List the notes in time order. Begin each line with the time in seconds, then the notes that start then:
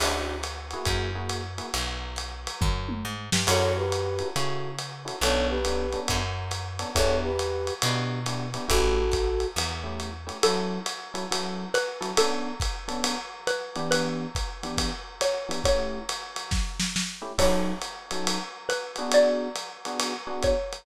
0.00 D2 C#4 D4 E4 F#4, crash, ride
0.43 hi-hat pedal, ride
0.71 A#3 E4 F#4 G#4, ride
0.85 F#2, kick, ride
1.15 A#3 E4 F#4 G#4
1.29 hi-hat pedal, ride
1.58 A#3 E4 F#4 G#4, ride
1.74 B1, ride
2.16 hi-hat pedal, ride
2.47 ride
2.61 F#2, kick, floor tom
2.89 mid tom
3.05 G#2
3.32 G2, snare
3.47 F#2 C#4 E4 F#4 A4 C#5, crash, ride
3.77 G4 B4
3.92 hi-hat pedal, ride
4.19 C#4 E4 F#4 A4, ride
4.36 C#3 C#4 E4 F#4 A4, ride
4.79 hi-hat pedal, ride
5.05 C#4 E4 F#4 A4, ride
5.21 B1 B3 C#4 D4 A4 C#5, ride
5.49 G4 B4
5.65 B3 C#4 D4 A4, hi-hat pedal, ride
5.92 B3 C#4 D4 A4, ride
6.08 F#2, kick, ride
6.51 hi-hat pedal, ride
6.79 B3 C#4 D4 A4, ride
6.95 E2 B3 D4 E4 G4 A4 C#5, kick, ride
7.23 G4 B4
7.39 hi-hat pedal, ride
7.67 ride
7.82 B2 B3 D4 E4 G4, ride
8.26 B3 D4 E4 G4, hi-hat pedal, ride
8.54 B3 D4 E4 G4, ride
8.68 A1 A3 C#4 E4 F#4 G4 A4, kick, ride
9.12 kick, hi-hat pedal, ride
9.40 ride
9.56 E2, ride
9.83 A3 C#4 E4 G4
10.00 hi-hat pedal, ride
10.27 A3 C#4 E4 G4, ride
10.43 F#3 C#4 E4 A4, ride
10.86 hi-hat pedal, ride
11.14 F#3 C#4 E4 A4, ride
11.31 F#3 C#4 E4 A4, ride
11.74 B4, hi-hat pedal, ride
12.01 F#3 C#4 E4 A4, ride
12.17 B3 C#4 D4 A4, ride
12.60 kick, hi-hat pedal, ride
12.88 B3 C#4 D4 A4, ride
13.04 ride
13.47 B4, hi-hat pedal, ride
13.76 E3 B3 D4 G4, ride
13.91 B4, ride
14.35 kick, hi-hat pedal, ride
14.63 E3 B3 D4 G4, ride
14.78 kick, ride
15.21 C#5, hi-hat pedal, ride
15.49 E3 B3 D4 G4, ride
15.64 A3 C#4 E4 G4 C#5, kick, ride
16.09 hi-hat pedal, ride
16.36 ride
16.51 kick, snare
16.80 snare
16.96 snare
17.22 A3 C#4 E4 G4
17.38 F#3 C#4 D#4 A4 C#5, kick, crash, ride
17.82 hi-hat pedal, ride
18.11 F#3 C#4 D#4 A4, ride
18.27 ride
18.69 B4, hi-hat pedal, ride
18.96 B3 D4 F#4 G#4, ride
19.12 D5, ride
19.56 hi-hat pedal, ride
19.85 B3 D4 F#4 G#4, ride
20.00 ride
20.27 B3 D4 F#4 G#4
20.43 C#5, kick, hi-hat pedal, ride
20.73 ride